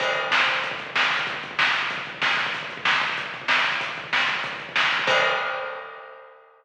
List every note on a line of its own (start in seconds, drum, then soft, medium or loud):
0.00 kick medium
0.00 crash medium
0.08 kick medium
0.16 kick medium
0.16 closed hi-hat medium
0.23 kick medium
0.31 kick medium
0.31 snare medium
0.40 kick medium
0.48 kick medium
0.48 closed hi-hat medium
0.55 kick medium
0.63 kick medium
0.63 closed hi-hat medium
0.71 kick medium
0.79 kick medium
0.79 closed hi-hat medium
0.87 kick medium
0.96 kick medium
0.96 snare medium
1.03 kick medium
1.10 kick medium
1.10 snare soft
1.10 open hi-hat medium
1.19 kick medium
1.27 kick medium
1.27 closed hi-hat medium
1.34 kick medium
1.43 kick medium
1.43 closed hi-hat medium
1.51 kick medium
1.59 kick medium
1.59 snare medium
1.68 kick medium
1.74 kick medium
1.74 closed hi-hat medium
1.83 kick medium
1.90 kick medium
1.90 closed hi-hat medium
1.98 kick medium
2.06 kick medium
2.06 closed hi-hat medium
2.14 kick medium
2.22 kick medium
2.22 snare medium
2.31 kick medium
2.37 kick medium
2.37 snare soft
2.37 open hi-hat medium
2.46 kick medium
2.54 kick medium
2.54 closed hi-hat medium
2.63 kick medium
2.70 kick medium
2.70 closed hi-hat medium
2.77 kick medium
2.85 kick medium
2.85 snare medium
2.93 kick medium
3.01 kick medium
3.01 closed hi-hat medium
3.09 kick medium
3.17 kick medium
3.17 closed hi-hat medium
3.26 kick medium
3.34 kick medium
3.34 closed hi-hat medium
3.42 kick medium
3.48 kick medium
3.48 snare medium
3.57 kick medium
3.64 kick medium
3.64 snare soft
3.64 closed hi-hat medium
3.72 kick medium
3.81 kick medium
3.81 closed hi-hat loud
3.89 kick medium
3.97 kick medium
3.97 closed hi-hat medium
4.04 kick medium
4.13 kick medium
4.13 snare medium
4.20 kick medium
4.29 kick medium
4.29 closed hi-hat medium
4.36 kick medium
4.43 kick medium
4.43 closed hi-hat medium
4.53 kick medium
4.59 kick medium
4.59 closed hi-hat medium
4.69 kick medium
4.76 kick medium
4.76 snare medium
4.84 kick medium
4.91 kick medium
4.91 snare soft
4.91 closed hi-hat medium
4.99 kick medium
5.07 kick loud
5.07 crash loud